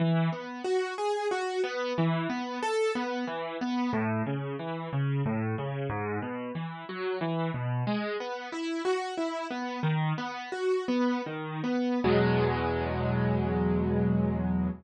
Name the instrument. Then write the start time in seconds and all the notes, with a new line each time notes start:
acoustic grand piano
0.00 E3
0.33 B3
0.64 F#4
0.98 G#4
1.31 F#4
1.64 B3
1.98 E3
2.30 B3
2.63 A4
2.95 B3
3.27 E3
3.61 B3
3.93 A2
4.26 C#3
4.59 E3
4.93 C#3
5.26 A2
5.58 C#3
5.90 G#2
6.22 B2
6.55 E3
6.89 F#3
7.21 E3
7.54 B2
7.87 G#3
8.20 B3
8.52 E4
8.85 F#4
9.17 E4
9.51 B3
9.83 D#3
10.18 B3
10.52 F#4
10.88 B3
11.26 D#3
11.64 B3
12.04 E2 B2 F#3 G#3